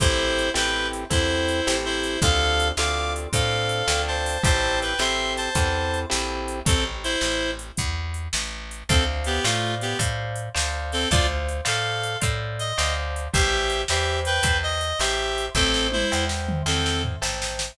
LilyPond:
<<
  \new Staff \with { instrumentName = "Clarinet" } { \time 12/8 \key a \minor \tempo 4. = 108 <e' c''>4. <b' g''>4 r8 <e' c''>2 <e' c''>4 | <a' f''>4. <f'' d'''>4 r8 <a' f''>2 <c'' a''>4 | <c'' a''>4 <b' g''>8 <e'' c'''>4 <c'' a''>2 r4. | <c' a'>8 r8 <e' c''>4. r2. r8 |
<c' a'>8 r8 <b g'>8 <a f'>4 <b g'>8 r2 r8 <c' a'>8 | <f' d''>8 r4 <a' f''>4. r4 ees''4 r4 | <g' e''>4. <g' e''>4 <b' g''>4 dis''4 <g' e''>4. | <c' a'>4 <e' c''>4 r4 <c' a'>4 r2 | }
  \new Staff \with { instrumentName = "Acoustic Guitar (steel)" } { \time 12/8 \key a \minor <c' e' g' a'>4. <c' e' g' a'>4. <c' e' g' a'>4. <c' e' g' a'>4. | <c' d' f' a'>4. <c' d' f' a'>4. <c' d' f' a'>4. <c' d' f' a'>4. | <c' e' g' a'>4. <c' e' g' a'>4. <c' e' g' a'>4. <c' e' g' a'>4. | r1. |
<c'' d'' f'' a''>4. <c'' d'' f'' a''>4. <c'' d'' f'' a''>4. <c'' d'' f'' a''>4. | <c'' d'' f'' a''>4. <c'' d'' f'' a''>4. <c'' d'' f'' a''>4. <c'' d'' f'' a''>4. | <c'' e'' g'' a''>4. <c'' e'' g'' a''>4. <c'' e'' g'' a''>4. <c'' e'' g'' a''>4. | <c'' e'' g'' a''>4. <c'' e'' g'' a''>4. <c'' e'' g'' a''>4. <c'' e'' g'' a''>4. | }
  \new Staff \with { instrumentName = "Electric Bass (finger)" } { \clef bass \time 12/8 \key a \minor a,,4. a,,4. e,4. a,,4. | d,4. d,4. a,4. d,4. | a,,4. a,,4. e,4. bes,,4. | a,,4. a,,4. e,4. a,,4. |
d,4. a,4. a,4. d,4. | d,4. a,4. a,4. d,4. | a,,4. e,4. e,4. a,,4. | a,,4. e,4. e,4. a,,4. | }
  \new DrumStaff \with { instrumentName = "Drums" } \drummode { \time 12/8 <hh bd>4 hh8 sn4 hh8 <hh bd>4 hh8 sn4 hh8 | <hh bd>4 hh8 sn4 hh8 <hh bd>4 hh8 sn4 hho8 | <hh bd>4 hh8 sn4 hh8 <hh bd>4 hh8 sn4 hh8 | <hh bd>4 hh8 sn4 hh8 <hh bd>4 hh8 sn4 hh8 |
<hh bd>4 hh8 sn4 hh8 <hh bd>4 hh8 sn4 hho8 | <hh bd>4 hh8 sn4 hh8 <hh bd>4 hh8 sn4 hh8 | <hh bd>4 hh8 sn4 hh8 <hh bd>4 hh8 sn4 hh8 | <bd sn>8 sn8 tommh8 sn8 sn8 toml8 sn8 sn8 tomfh8 sn8 sn8 sn8 | }
>>